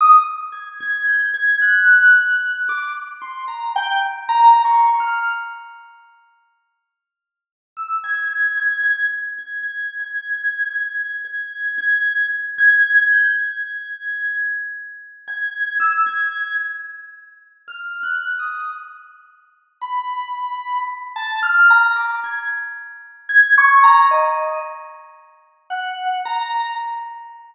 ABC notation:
X:1
M:5/8
L:1/16
Q:1/4=56
K:none
V:1 name="Drawbar Organ"
_e' z _a' a' g' a' _g'4 | d' z c' _b g z (3b2 _d'2 f'2 | z9 e' | _a' a' a' a' z a' (3a'2 a'2 a'2 |
_a'2 a'2 a'2 z a'2 g' | _a'4 z3 a'2 e' | _a'2 z4 (3f'2 _g'2 _e'2 | z4 b4 z a |
f' _b d' _a' z3 a' _d' b | _e2 z4 _g2 _b2 |]